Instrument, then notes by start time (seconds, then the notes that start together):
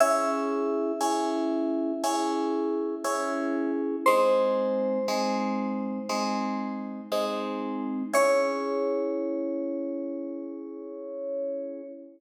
electric piano 2
0.00 C#4 E4 G#4 E5
1.01 C#4 E4 G#4
2.04 C#4 E4 G#4
3.04 C#4 E4 G#4
4.06 G#3 C4 D#4 C5
5.08 G#3 C4 D#4
6.09 G#3 C4 D#4
7.12 G#3 C4 D#4
8.13 C#4 E4 G#4 C#5